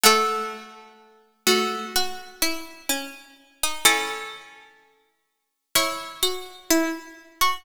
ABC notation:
X:1
M:4/4
L:1/16
Q:1/4=63
K:C#m
V:1 name="Harpsichord"
[A,F]6 [A,F]2 z8 | [CA]8 [Ec]8 |]
V:2 name="Harpsichord"
A,8 F2 E2 C3 D | E8 E2 F2 E3 F |]